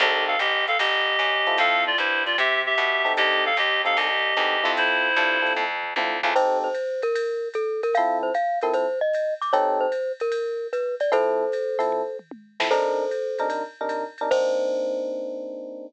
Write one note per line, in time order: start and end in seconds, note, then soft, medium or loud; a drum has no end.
0.00 0.37 C2 medium
0.00 0.35 C4 medium
0.00 0.35 D#4 medium
0.00 0.24 G4 medium
0.00 0.35 G4 medium
0.00 0.35 A4 medium
0.00 0.24 D#5 medium
0.00 ride medium
0.28 0.39 A4 medium
0.28 0.39 F5 medium
0.39 0.77 A1 medium
0.39 0.65 G4 medium
0.39 0.65 D#5 medium
0.39 hi-hat pedal medium
0.39 ride medium
0.68 0.78 A4 medium
0.68 0.78 F5 medium
0.68 ride medium
0.79 1.17 G1 medium
0.79 1.57 G4 medium
0.79 1.57 D#5 medium
0.79 kick soft
0.79 ride loud
1.19 1.56 F#2 medium
1.19 hi-hat pedal medium
1.19 ride medium
1.47 1.91 C4 loud
1.47 1.91 E4 medium
1.47 1.91 F4 medium
1.47 1.91 A4 medium
1.47 ride medium
1.58 1.96 F2 medium
1.58 1.84 A4 medium
1.58 1.84 F5 loud
1.58 ride medium
1.87 1.98 F4 medium
1.87 1.98 D5 medium
1.98 2.35 G2 medium
1.98 2.23 E4 medium
1.98 2.23 C5 medium
1.98 hi-hat pedal medium
1.98 ride medium
2.26 2.37 F4 medium
2.26 2.37 D5 medium
2.26 ride medium
2.38 2.75 C3 medium
2.38 2.62 G4 medium
2.38 2.62 E5 medium
2.38 kick soft
2.38 ride medium
2.66 3.13 G4 medium
2.66 3.13 E5 medium
2.77 3.15 B2 medium
2.77 kick soft
2.77 hi-hat pedal medium
2.77 ride medium
3.05 3.49 C4 medium
3.05 3.49 D#4 medium
3.05 3.49 G4 medium
3.05 3.49 A4 medium
3.05 ride medium
3.17 3.55 C2 medium
3.17 3.44 G4 medium
3.17 3.44 D#5 loud
3.17 kick soft
3.17 ride medium
3.46 3.57 A4 medium
3.46 3.57 F5 medium
3.57 3.94 D#2 medium
3.57 3.82 G4 medium
3.57 3.82 D#5 medium
3.57 hi-hat pedal medium
3.57 ride medium
3.85 4.08 C4 medium
3.85 4.08 D#4 medium
3.85 4.08 G4 medium
3.85 4.08 A4 medium
3.85 3.97 A4 medium
3.85 3.97 F5 medium
3.85 ride medium
3.96 4.34 C2 medium
3.96 4.72 G4 medium
3.96 4.72 D#5 medium
3.96 ride medium
4.36 4.63 E2 medium
4.36 4.56 C4 medium
4.36 4.56 D#4 medium
4.36 4.56 G4 medium
4.36 4.56 A4 medium
4.36 hi-hat pedal medium
4.36 ride medium
4.64 5.14 F2 medium
4.64 5.08 C4 medium
4.64 5.08 E4 loud
4.64 5.08 F4 loud
4.64 5.08 A4 medium
4.64 ride medium
4.77 5.53 E4 medium
4.77 5.53 C5 loud
4.77 ride medium
5.15 5.54 G2 medium
5.15 5.38 C4 medium
5.15 5.38 E4 medium
5.15 5.38 F4 medium
5.15 5.38 A4 medium
5.15 kick soft
5.15 hi-hat pedal medium
5.15 ride medium
5.42 5.65 C4 medium
5.42 5.65 E4 medium
5.42 5.65 F4 medium
5.42 5.65 A4 medium
5.46 ride medium
5.55 5.94 F2 medium
5.55 kick medium
5.55 high tom medium
5.83 floor tom medium
5.96 6.21 D2 medium
5.96 6.17 C4 medium
5.96 6.17 E4 medium
5.96 6.17 F4 medium
5.96 6.17 A4 medium
5.96 high tom medium
6.23 6.34 C#2 medium
6.23 6.33 C4 medium
6.23 6.33 E4 medium
6.23 6.33 F4 medium
6.23 6.33 A4 medium
6.23 floor tom medium
6.35 6.68 C4 loud
6.35 6.68 D#4 loud
6.35 6.68 G4 loud
6.35 6.68 A4 loud
6.35 6.58 C5 loud
6.35 crash medium
6.35 ride medium
6.64 7.01 C5 medium
6.75 kick soft
6.75 hi-hat pedal medium
6.75 ride medium
7.02 7.48 A#4 medium
7.02 ride medium
7.15 ride loud
7.54 7.81 A4 medium
7.54 kick medium
7.54 hi-hat pedal medium
7.54 ride medium
7.83 7.95 A#4 medium
7.83 ride medium
7.94 8.30 F3 loud
7.94 8.30 C4 loud
7.94 8.30 E4 loud
7.94 8.30 A4 loud
7.94 8.18 F5 medium
7.94 kick medium
7.94 ride medium
8.23 8.33 C5 medium
8.34 8.59 F5 medium
8.34 hi-hat pedal medium
8.34 ride medium
8.61 8.86 F3 medium
8.61 8.86 C4 loud
8.61 8.86 E4 medium
8.61 8.86 A4 medium
8.61 8.74 A#4 medium
8.61 ride medium
8.74 8.99 C5 medium
8.74 ride medium
9.01 9.34 D#5 medium
9.13 hi-hat pedal medium
9.13 ride medium
9.41 9.53 D6 medium
9.41 ride medium
9.53 9.86 C4 loud
9.53 9.86 D#4 loud
9.53 9.86 G4 loud
9.53 9.86 A4 loud
9.53 9.79 C#5 medium
9.53 ride medium
9.81 10.12 C5 medium
9.92 hi-hat pedal medium
9.92 ride medium
10.20 10.67 A#4 medium
10.20 ride medium
10.32 ride medium
10.73 10.95 B4 medium
10.73 hi-hat pedal medium
10.73 ride medium
11.00 11.11 D5 medium
11.00 ride medium
11.12 11.44 F3 loud
11.12 11.44 C4 loud
11.12 11.44 E4 loud
11.12 11.44 A4 loud
11.12 12.17 A4 medium
11.12 12.17 C5 medium
11.12 ride medium
11.52 hi-hat pedal medium
11.52 ride medium
11.79 12.02 F3 loud
11.79 12.02 C4 medium
11.79 12.02 E4 medium
11.79 12.02 A4 medium
11.79 ride medium
11.92 kick medium
11.92 floor tom medium
12.19 mid tom medium
12.31 high tom medium
12.60 12.68 F3 medium
12.60 12.68 C4 medium
12.60 12.68 E4 loud
12.60 12.68 A4 medium
12.60 snare medium
12.71 13.04 C3 loud
12.71 13.04 D4 loud
12.71 13.04 D#4 loud
12.71 13.48 A4 medium
12.71 13.04 A#4 loud
12.71 13.48 C5 medium
12.71 crash medium
12.71 ride medium
13.11 hi-hat pedal medium
13.11 ride medium
13.38 13.63 C3 medium
13.38 13.63 D4 medium
13.38 13.63 D#4 medium
13.38 13.63 A#4 loud
13.38 ride medium
13.50 ride medium
13.81 14.04 C3 loud
13.81 14.04 D4 medium
13.81 14.04 D#4 medium
13.81 14.04 A#4 medium
13.89 hi-hat pedal medium
13.89 ride medium
14.18 14.29 C3 medium
14.18 14.29 D4 loud
14.18 14.29 D#4 medium
14.18 14.29 A#4 medium
14.18 ride medium
14.31 15.86 A#3 loud
14.31 15.86 C4 medium
14.31 15.86 D4 medium
14.31 15.86 D#4 loud
14.31 15.86 C5 loud
14.31 kick loud
14.31 crash loud